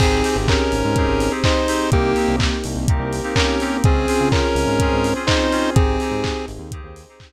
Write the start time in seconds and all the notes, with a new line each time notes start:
0.00 G#1 C4 D#4 G4 G#4, kick, crash
0.24 C4 D#4 G4 G#4, open hi-hat
0.36 G#1
0.48 C#4 A#4, kick, clap
0.72 G#1, open hi-hat
0.85 G#2
0.96 C4 D#4 G4 G#4 C5, kick, closed hi-hat
1.08 G#1
1.20 open hi-hat
1.31 C4 D#4 G4 G#4
1.43 C4 D#4 G4 G#4 C5, kick, clap
1.68 C4 D#4 G4 G#4, open hi-hat
1.91 C2 A#3 C4 D#4 G4, kick, closed hi-hat
2.16 A#3 C4 D#4 G4, open hi-hat
2.28 C2
2.40 kick, clap
2.64 C2, open hi-hat
2.76 C2
2.88 A#3 C4 D#4 G4 A#4, kick, closed hi-hat
3.00 C2
3.13 open hi-hat
3.23 A#3 C4 D#4 G4
3.36 A#3 C4 C#4 D#4 G4 A#4, kick, clap
3.60 A#3 C4 D#4 G4, open hi-hat
3.84 C#2 C4 C#4 F4 G#4, kick, closed hi-hat
4.07 C4 C#4 F4 G#4, open hi-hat
4.21 C#3
4.32 C#4 A#4, kick, clap
4.55 C#2, open hi-hat
4.67 G#2
4.79 C4 C#4 F4 G#4 C5, kick, closed hi-hat
4.92 G#2
5.04 open hi-hat
5.15 C4 C#4 F4 G#4
5.27 C4 C#4 D#4 F4 G#4 C5, kick, clap
5.51 C4 C#4 F4 G#4, open hi-hat
5.75 G#1 C4 D#4 G4 G#4, kick, closed hi-hat
6.00 C4 D#4 G4 G#4, open hi-hat
6.12 G#2
6.24 kick, clap
6.48 G#1, open hi-hat
6.59 D#2
6.71 C4 D#4 G4 G#4 C5, kick, closed hi-hat
6.84 D#2
6.96 open hi-hat
7.09 C4 D#4 G4 G#4
7.20 C4 D#4 G4 G#4, kick, clap